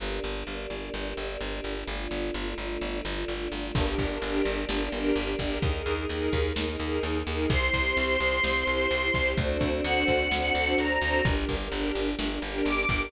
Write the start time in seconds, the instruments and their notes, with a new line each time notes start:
0.00 electric bass (finger) G1, choir aahs A#3 D4 G4
0.24 electric bass (finger) G1
0.47 electric bass (finger) G1
0.70 electric bass (finger) G1
0.94 electric bass (finger) G1
1.17 electric bass (finger) G1
1.41 electric bass (finger) G1
1.64 electric bass (finger) G1
1.88 electric bass (finger) G1, choir aahs A3 D4 F4
2.11 electric bass (finger) G1
2.34 electric bass (finger) G1
2.58 electric bass (finger) G1
2.81 electric bass (finger) G1
3.05 electric bass (finger) G1
3.28 electric bass (finger) G1
3.52 electric bass (finger) G1
3.75 electric bass (finger) G1, choir aahs A#3 D4 G4, string ensemble 1 D4 G4 A#4, kick, crash
3.87 string ensemble 1 D4 G4 A#4
3.98 electric bass (finger) G1, kick, closed hi-hat
4.08 string ensemble 1 D4 G4 A#4
4.22 electric bass (finger) G1, string ensemble 1 D4 G4 A#4, closed hi-hat
4.45 electric bass (finger) G1, closed hi-hat
4.69 electric bass (finger) G1, string ensemble 1 D4 G4 A#4, snare
4.81 string ensemble 1 D4 G4 A#4
4.92 electric bass (finger) G1, string ensemble 1 D4 G4 A#4, closed hi-hat
5.16 electric bass (finger) G1, closed hi-hat
5.39 electric bass (finger) G1, string ensemble 1 D4 G4 A#4, kick, closed hi-hat
5.62 electric bass (finger) D#2, choir aahs A#3 D#4 G#4, string ensemble 1 D#4 G#4 A#4, kick, closed hi-hat
5.75 string ensemble 1 D#4 G#4 A#4
5.86 electric bass (finger) D#2, closed hi-hat
5.96 string ensemble 1 D#4 G#4 A#4
6.09 electric bass (finger) D#2, string ensemble 1 D#4 G#4 A#4, closed hi-hat
6.33 electric bass (finger) D#2, kick, closed hi-hat
6.55 electric bass (finger) D#2, string ensemble 1 D#4 G#4 A#4, snare
6.67 string ensemble 1 D#4 G#4 A#4
6.80 electric bass (finger) D#2, string ensemble 1 D#4 G#4 A#4, closed hi-hat
7.03 electric bass (finger) D#2, closed hi-hat
7.26 electric bass (finger) D#2, string ensemble 1 D#4 G#4 A#4, closed hi-hat
7.50 electric bass (finger) C2, choir aahs C4 E4 G4 C6, string ensemble 1 E4 G4 C5, kick, closed hi-hat
7.62 string ensemble 1 E4 G4 C5
7.73 electric bass (finger) C2, kick, closed hi-hat
7.86 string ensemble 1 E4 G4 C5
7.97 electric bass (finger) C2, string ensemble 1 E4 G4 C5, closed hi-hat
8.20 electric bass (finger) C2, closed hi-hat
8.42 electric bass (finger) C2, string ensemble 1 E4 G4 C5, snare
8.57 string ensemble 1 E4 G4 C5
8.67 electric bass (finger) C2, string ensemble 1 E4 G4 C5, closed hi-hat
8.91 electric bass (finger) C2, closed hi-hat
9.12 electric bass (finger) C2, string ensemble 1 E4 G4 C5, kick, closed hi-hat
9.36 electric bass (finger) D2, choir aahs C4 D4 F#4 A4, string ensemble 1 D4 F#4 A4 C5, kick, closed hi-hat
9.49 string ensemble 1 D4 F#4 A4 C5
9.61 electric bass (finger) D2, kick, closed hi-hat
9.72 string ensemble 1 D4 F#4 A4 C5
9.83 electric bass (finger) D2, string ensemble 1 D4 F#4 A4 C5, choir aahs F#5, closed hi-hat
10.08 electric bass (finger) D2, kick, closed hi-hat
10.31 electric bass (finger) D2, string ensemble 1 D4 F#4 A4 C5, snare
10.44 string ensemble 1 D4 F#4 A4 C5
10.53 electric bass (finger) D2, string ensemble 1 D4 F#4 A4 C5, closed hi-hat
10.78 electric bass (finger) D2, choir aahs A#5, closed hi-hat
11.01 electric bass (finger) D2, string ensemble 1 D4 F#4 A4 C5, closed hi-hat
11.25 electric bass (finger) G1, string ensemble 1 D4 G4 A#4, kick, closed hi-hat
11.37 string ensemble 1 D4 G4 A#4
11.48 electric bass (finger) G1, kick, closed hi-hat
11.61 string ensemble 1 D4 G4 A#4
11.72 electric bass (finger) G1, string ensemble 1 D4 G4 A#4, closed hi-hat
11.95 electric bass (finger) G1, closed hi-hat
12.17 electric bass (finger) G1, string ensemble 1 D4 G4 A#4, snare
12.30 string ensemble 1 D4 G4 A#4
12.42 electric bass (finger) G1, string ensemble 1 D4 G4 A#4, closed hi-hat
12.65 electric bass (finger) G1, choir aahs D6, closed hi-hat
12.89 electric bass (finger) G1, string ensemble 1 D4 G4 A#4, kick, closed hi-hat